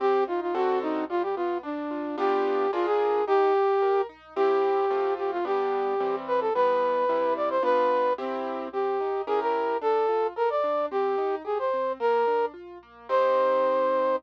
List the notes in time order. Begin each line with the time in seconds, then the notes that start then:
0.00 C4 G4
0.27 D#4 F4
0.41 F4
0.55 D3 C4 F#4 A4
0.82 D#4
1.10 G3 F4
1.22 G4
1.36 B3 F4
1.63 D4
1.91 F4
2.18 B3 D4 F4 G4
2.73 D4 F4 G#4 A#4
2.86 G#4
3.27 D#4 G4
3.54 G4
3.82 A#4
4.09 D#4
4.36 C4 E4 G4
4.90 A3 C4 F4
5.18 G4
5.31 F4
5.45 G3 B3 D4 G4
6.00 E3 G3 C4
6.27 B4
6.40 A4
6.54 E3 G3 B3 B4
7.09 C3 G3 E4
7.36 D5
7.50 C5
7.63 B3 D4 F4 B4
8.18 C4 E4 G4
8.73 C4 G4
9.00 D#4
9.27 C#4 E4 G4 G#4 A#4
9.41 A#4
9.81 D4 A4
10.09 F4
10.36 A4 A#4
10.50 D5
10.64 D4
10.91 C4 G4
11.18 D#4
11.45 G4 G#4
11.59 C5
11.73 C4
12.00 A#3 A#4
12.27 D4
12.54 F4
12.83 A#3
13.09 C4 D#4 G4 C5